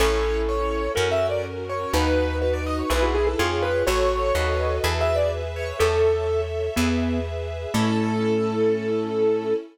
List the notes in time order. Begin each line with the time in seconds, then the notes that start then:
0.00 A1 C#4 E4 A4 C#5
0.49 C#5
0.95 F#2 C#4 F#4 A#4
1.11 E5
1.30 D5
1.69 C#5
1.93 D#2 D#4 F#4 B4
2.42 B4
2.54 D5
2.67 D#5
2.79 C#5
2.90 B1 E4 G#4 B4
3.03 F#4
3.15 G#4
3.27 A4
3.38 F2 F4 G#4 C#5
3.63 B4
3.87 A1 F#4 A4 C#5
4.34 D#2 F#4 A4 B4 C#5 D#5
4.83 E2 G#4 A4 B4 E5
5.01 E5
5.16 D5
5.56 C#5
5.79 E2 A4 C#5 E5
6.76 E2 B3 G#4 B4 E5
7.74 A2 A3 C#4 E4 A4